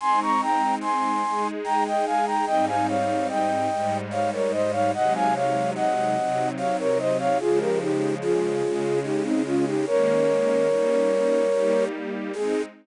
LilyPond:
<<
  \new Staff \with { instrumentName = "Flute" } { \time 3/4 \key aes \major \tempo 4 = 73 <aes'' c'''>16 <bes'' des'''>16 <g'' bes''>8 <aes'' c'''>4 <g'' bes''>16 <ees'' g''>16 <f'' aes''>16 <g'' bes''>16 | <ees'' g''>16 <f'' aes''>16 <des'' f''>8 <ees'' g''>4 <des'' f''>16 <bes' des''>16 <c'' ees''>16 <des'' f''>16 | <ees'' ges''>16 <f'' aes''>16 <des'' f''>8 <ees'' ges''>4 <des'' f''>16 <bes' des''>16 <c'' ees''>16 <des'' f''>16 | <f' aes'>16 <g' bes'>16 <ees' g'>8 <f' aes'>4 <ees' g'>16 <c' ees'>16 <des' f'>16 <ees' g'>16 |
<bes' des''>2~ <bes' des''>8 r8 | aes'4 r2 | }
  \new Staff \with { instrumentName = "String Ensemble 1" } { \time 3/4 \key aes \major <aes c' ees'>4. <aes ees' aes'>4. | <aes, g c' ees'>4. <aes, g aes ees'>4. | <c ges aes ees'>4. <c ges c' ees'>4. | <des f aes>4. <des aes des'>4. |
<ees aes bes des'>4 <g bes des' ees'>4 <g bes ees' g'>4 | <aes c' ees'>4 r2 | }
>>